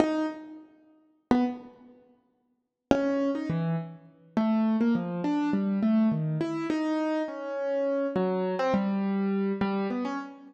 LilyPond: \new Staff { \time 5/8 \tempo 4 = 103 dis'8 r4. r16 b16 | r2 r8 | cis'8. dis'16 e8 r4 | a8. ais16 f8 d'8 g8 |
a8 dis8 e'8 dis'4 | cis'4. fis8. c'16 | g4. g8 b16 cis'16 | }